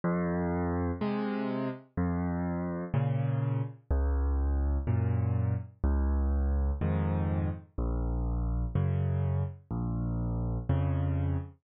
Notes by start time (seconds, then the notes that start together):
0.04 F2
1.01 C3 G#3
1.97 F2
2.94 A#2 C#3
3.91 C#2
4.87 F#2 A#2
5.83 C#2
6.81 F2 G#2 D#3
7.78 A#1
8.75 F#2 C#3
9.71 A#1
10.69 F2 C#3